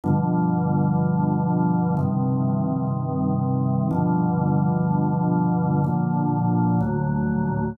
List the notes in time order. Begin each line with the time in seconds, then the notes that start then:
0.04 G2 B2 D3 F3
1.97 G2 C3 D#3
3.91 G2 B2 D3 F3
5.84 A#2 D3 F3
6.80 D2 A2 F#3